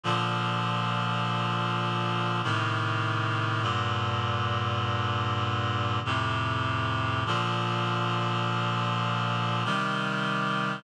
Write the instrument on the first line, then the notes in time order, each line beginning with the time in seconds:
clarinet
0.04 A#2 D3 F3
2.43 A2 C3 D#3
3.62 G2 A#2 D3
6.05 F2 A2 C3
7.26 A#2 D3 F3
9.64 C3 D#3 G3